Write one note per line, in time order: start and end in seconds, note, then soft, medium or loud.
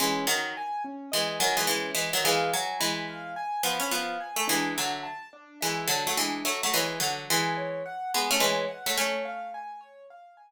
0.00 0.25 E3 loud
0.00 0.25 G#3 loud
0.00 0.26 C#4 medium
0.27 0.53 D#3 loud
0.27 0.53 F#3 loud
0.27 0.53 D#5 medium
0.57 0.83 G#5 medium
0.84 1.10 C#4 medium
1.12 1.39 E3 medium
1.12 1.39 G#3 loud
1.12 1.38 D#5 medium
1.39 1.56 D#3 loud
1.39 1.56 F#3 loud
1.39 1.65 G#5 medium
1.57 1.67 E3 medium
1.57 1.67 G#3 loud
1.67 1.91 E3 medium
1.67 1.91 G#3 loud
1.67 1.94 C#4 medium
1.95 2.10 E3 medium
1.95 2.10 G#3 loud
1.95 2.22 D#5 medium
2.13 2.24 D#3 loud
2.13 2.24 F#3 loud
2.24 2.51 E3 loud
2.24 2.51 G#3 loud
2.24 2.50 F5 medium
2.53 2.77 F#3 loud
2.53 2.79 G#5 medium
2.80 3.34 E3 medium
2.80 3.34 G#3 loud
2.80 3.06 B5 medium
3.08 3.33 F5 medium
3.36 3.62 G#5 medium
3.63 3.79 F3 loud
3.63 3.79 B3 loud
3.63 3.91 B5 medium
3.80 3.90 C#4 loud
3.91 4.18 F3 medium
3.91 4.18 B3 loud
3.91 4.19 F5 medium
4.20 4.46 G#5 medium
4.36 4.47 A3 loud
4.48 4.74 E3 loud
4.48 4.74 G#3 loud
4.48 4.73 D4 medium
4.75 5.04 D3 medium
4.75 5.04 F#3 medium
4.75 5.01 E5 medium
5.03 5.29 A5 medium
5.33 5.59 D4 medium
5.61 5.87 E3 medium
5.61 5.87 G#3 medium
5.61 5.86 E5 medium
5.88 6.03 D3 medium
5.88 6.03 F#3 loud
5.88 6.15 A5 medium
6.07 6.18 F#3 medium
6.07 6.18 A3 loud
6.17 6.41 E3 medium
6.17 6.41 G#3 loud
6.17 6.43 D4 medium
6.45 6.61 F#3 medium
6.45 6.61 A3 loud
6.45 6.71 E5 medium
6.63 6.74 F#3 medium
6.63 6.74 A3 loud
6.74 6.98 E3 loud
6.74 6.98 G#3 loud
6.74 6.99 C#5 medium
7.00 7.25 D3 medium
7.00 7.25 F#3 loud
7.00 7.26 F#5 medium
7.30 7.83 E3 loud
7.30 7.83 G#3 loud
7.30 7.56 G#5 medium
7.57 7.83 C#5 medium
7.86 8.11 F#5 medium
8.14 8.30 G#3 medium
8.14 8.30 B3 loud
8.14 8.40 G#5 medium
8.31 8.41 A3 loud
8.31 8.41 C#4 loud
8.40 8.65 E3 medium
8.40 8.65 G#3 loud
8.40 8.68 C#5 medium
8.68 8.94 F#5 medium
8.86 8.97 F#3 medium
8.86 8.97 A3 loud
8.97 10.47 A3 loud
8.97 10.47 C#4 loud
8.97 9.23 C#5 medium
9.25 9.51 F5 medium
9.54 9.80 G#5 medium
9.81 10.07 C#5 medium
10.10 10.36 F5 medium
10.37 10.51 G#5 medium